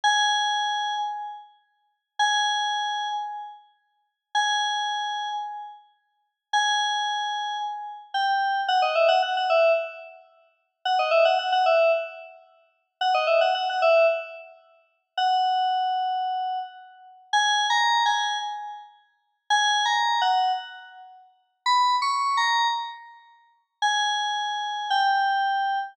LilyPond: \new Staff { \time 4/4 \key gis \minor \tempo 4 = 111 gis''2 r2 | gis''2 r2 | gis''2 r2 | gis''2 r4 g''4 |
\key b \major fis''16 dis''16 e''16 fis''16 fis''16 fis''16 e''8 r2 | fis''16 dis''16 e''16 fis''16 fis''16 fis''16 e''8 r2 | fis''16 dis''16 e''16 fis''16 fis''16 fis''16 e''8 r2 | fis''2. r4 |
\key gis \minor \tuplet 3/2 { gis''4 ais''4 gis''4 } r2 | \tuplet 3/2 { gis''4 ais''4 fis''4 } r2 | \tuplet 3/2 { b''4 cis'''4 ais''4 } r2 | gis''2 g''2 | }